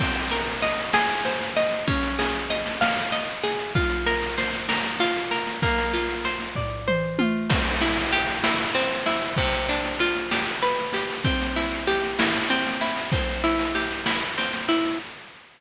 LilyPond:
<<
  \new Staff \with { instrumentName = "Overdriven Guitar" } { \time 6/8 \key c \minor \tempo 4. = 64 c'8 bes'8 ees''8 aes'8 c''8 ees''8 | des'8 aes'8 ees''8 f''8 ees''8 aes'8 | f'8 bes'8 c''8 bes'8 f'8 bes'8 | bes8 f'8 c''8 d''8 c''8 f'8 |
\key c \major c'8 e'8 g'8 e'8 c'8 e'8 | c8 d'8 f'8 g'8 b'8 g'8 | c'8 e'8 g'8 e'8 c'8 e'8 | c'8 e'8 g'8 e'8 c'8 e'8 | }
  \new DrumStaff \with { instrumentName = "Drums" } \drummode { \time 6/8 <cymc bd sn>16 sn16 sn16 sn16 sn16 sn16 sn16 sn16 sn16 sn16 sn16 sn16 | <bd sn>16 sn16 sn16 sn16 sn16 sn16 sn16 sn16 sn16 sn16 sn16 sn16 | <bd sn>16 sn16 sn16 sn16 sn16 sn16 sn16 sn16 sn16 sn16 sn16 sn16 | <bd sn>16 sn16 sn16 sn16 sn16 sn16 <bd tomfh>8 toml8 tommh8 |
<cymc bd sn>16 sn16 sn16 sn16 sn16 sn16 sn16 sn16 sn16 sn16 sn16 sn16 | <bd sn>16 sn16 sn16 sn16 sn16 sn16 sn16 sn16 sn16 sn16 sn16 sn16 | <bd sn>16 sn16 sn16 sn16 sn16 sn16 sn16 sn16 sn16 sn16 sn16 sn16 | <bd sn>16 sn16 sn16 sn16 sn16 sn16 sn16 sn16 sn16 sn16 sn16 sn16 | }
>>